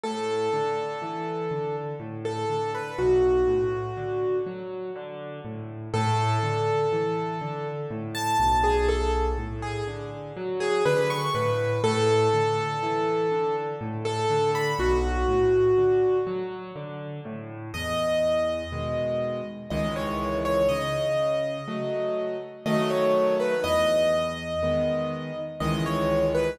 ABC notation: X:1
M:3/4
L:1/16
Q:1/4=61
K:A
V:1 name="Acoustic Grand Piano"
A8 z A2 B | F6 z6 | A8 z a2 G | A z2 G z3 G B c' B2 |
A8 z A2 b | F6 z6 | [K:E] d8 d c2 c | d8 d c2 B |
d8 d c2 B |]
V:2 name="Acoustic Grand Piano"
A,,2 D,2 E,2 D,2 A,,2 D,2 | B,,,2 A,,2 D,2 F,2 D,2 A,,2 | A,,2 D,2 E,2 D,2 A,,2 B,,,2- | B,,,2 A,,2 D,2 F,2 D,2 A,,2 |
A,,2 D,2 E,2 D,2 A,,2 D,2 | B,,,2 A,,2 D,2 F,2 D,2 A,,2 | [K:E] E,,4 [B,,D,G,]4 [C,,D,E,G,]4 | C,4 [F,A,]4 [D,F,A,]4 |
E,,4 [D,G,B,]4 [C,,D,E,G,]4 |]